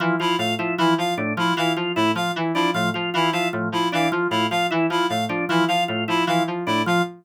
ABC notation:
X:1
M:3/4
L:1/8
Q:1/4=153
K:none
V:1 name="Electric Piano 2" clef=bass
E, F, A,, F, E, F, | A,, F, E, F, A,, F, | E, F, A,, F, E, F, | A,, F, E, F, A,, F, |
E, F, A,, F, E, F, | A,, F, E, F, A,, F, |]
V:2 name="Drawbar Organ"
F, F F E F, z | D F, F F E F, | z D F, F F E | F, z D F, F F |
E F, z D F, F | F E F, z D F, |]
V:3 name="Clarinet"
z E f z E f | z E f z E f | z E f z E f | z E f z E f |
z E f z E f | z E f z E f |]